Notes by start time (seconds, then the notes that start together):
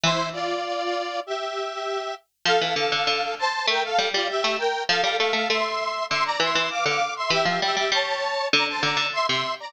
0.04 E3 E4 C5
0.33 F4 D5
1.27 G4 E5
2.45 F3 A4 F5
2.61 E3
2.76 D3 A4 F5
2.92 D3
3.07 D3
3.39 C5 A5
3.67 A3 A#4 G5
3.84 A4 F5
3.98 G3
4.14 G3 F4 D5
4.29 G4 E5
4.44 A3
4.58 A#4 G5
4.89 F3 A4 F5
5.02 G3 A4 F5
5.19 A3 A4 F5
5.33 A3 A4 F5
5.49 A3 E5 C6
6.10 D3 E5 C6
6.25 D5 A#5
6.40 E3 E5 C6
6.55 E3
6.70 F5 D6
6.86 D3 F5 D6
7.16 E5 C6
7.30 E3 G4 E5
7.45 F3 G4 E5
7.62 G3 G4 E5
7.76 G3 G4 E5
7.92 G3 C#5 A5
8.52 D3 D5 A#5
8.68 C5 A5
8.82 D3 D5 A#5
8.97 D3
9.13 E5 C6
9.27 C3 E5 C6
9.60 D5 A#5